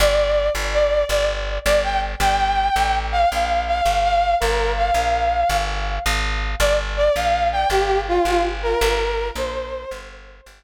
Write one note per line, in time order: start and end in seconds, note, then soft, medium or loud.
0.00 0.50 G1 medium
0.00 0.49 D5 loud
0.55 1.04 G1 medium
0.74 1.04 D5 loud
1.09 1.59 G1 medium
1.09 1.27 D5 loud
1.65 2.15 G1 medium
1.65 1.81 D5 loud
1.83 2.00 G5 loud
2.20 2.69 G1 medium
2.20 2.95 G5 loud
2.76 3.25 A1 medium
3.12 3.29 F5 loud
3.31 3.81 A#1 medium
3.31 3.63 F5 medium
3.67 4.03 F5 medium
3.85 4.35 G1 medium
4.03 4.35 F5 loud
4.40 4.91 G1 medium
4.40 4.72 A#4 loud
4.77 5.57 F5 medium
4.94 5.44 A#1 medium
5.49 5.99 G1 medium
6.06 6.55 G#1 medium
6.60 7.09 G1 medium
6.60 6.75 D5 loud
6.97 7.15 D5 loud
7.16 7.65 A#1 medium
7.16 7.48 F5 loud
7.52 7.69 G5 loud
7.70 8.19 G1 medium
7.70 8.01 G4 loud
8.08 8.25 F4 loud
8.25 8.75 G1 medium
8.25 8.42 F4 loud
8.63 8.80 A#4 loud
8.81 9.31 G1 medium
8.81 9.28 A#4 loud
9.35 9.85 A#1 medium
9.35 9.99 C5 loud
9.91 10.41 G1 medium
10.46 10.63 G1 medium